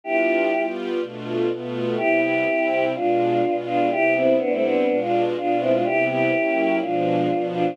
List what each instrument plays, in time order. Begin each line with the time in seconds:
0.04 string ensemble 1 G3 B3 D4 F4, choir aahs E4 G4
0.53 string ensemble 1 G3 B3 F4 G4
1.00 string ensemble 1 B2 A3 D4 F4
1.49 string ensemble 1 B2 A3 B3 F4
1.97 string ensemble 1 C3 G3 B3 E4, choir aahs E4 G4
2.22 choir aahs E4 G4
2.45 string ensemble 1 C3 G3 C4 E4
2.94 string ensemble 1 B2 G#3 D4 F4, choir aahs D4 F4
3.42 string ensemble 1 B2 G#3 B3 F4
3.66 choir aahs D4 F4
3.91 string ensemble 1 C3 G3 B3 E4, choir aahs E4 G4
4.15 choir aahs C4 E4
4.38 string ensemble 1 C3 G3 C4 E4, choir aahs B3 D4
4.51 choir aahs A3 C4
4.62 choir aahs B3 D4
4.88 string ensemble 1 B2 G#3 D4 F4
4.99 choir aahs D4 F4
5.36 string ensemble 1 B2 G#3 B3 F4, choir aahs D4 F4
5.60 choir aahs C4 E4
5.72 choir aahs D4 F4
5.84 string ensemble 1 C3 G3 B3 E4, choir aahs E4 G4
6.10 choir aahs E4 G4
6.33 string ensemble 1 F#3 A#3 C#4 E4
6.80 string ensemble 1 B2 F3 G#3 D4, choir aahs D4 F4
7.30 string ensemble 1 B2 F3 B3 D4
7.54 choir aahs D4 F4